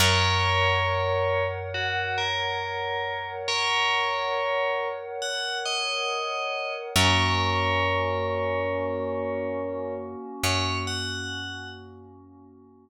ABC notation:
X:1
M:4/4
L:1/8
Q:1/4=69
K:Gblyd
V:1 name="Tubular Bells"
[Bd]4 G B3 | [Bd]4 g e3 | [Bd]8 | d g2 z5 |]
V:2 name="Pad 5 (bowed)"
[Bdg]8- | [Bdg]8 | [B,DG]8- | [B,DG]8 |]
V:3 name="Electric Bass (finger)" clef=bass
G,,8- | G,,8 | G,,8 | G,,8 |]